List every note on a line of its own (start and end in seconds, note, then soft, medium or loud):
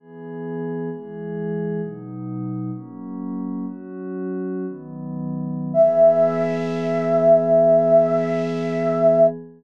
0.00 0.89 E3 medium
0.00 0.89 B3 medium
0.00 0.89 G#4 loud
0.91 1.81 E3 loud
0.91 1.81 G#3 medium
0.91 1.81 G#4 loud
1.81 2.71 B2 medium
1.81 2.71 F#3 medium
1.81 2.71 D#4 medium
2.73 3.65 F#3 medium
2.73 3.65 A#3 medium
2.73 3.65 C#4 medium
3.66 4.65 F#3 medium
3.66 4.65 C#4 medium
3.66 4.65 F#4 medium
4.66 5.72 D#3 loud
4.66 5.72 F#3 medium
4.66 5.72 B3 medium
5.73 9.26 E3 loud
5.73 9.26 B3 loud
5.73 9.26 G#4 loud
5.73 9.27 E5 loud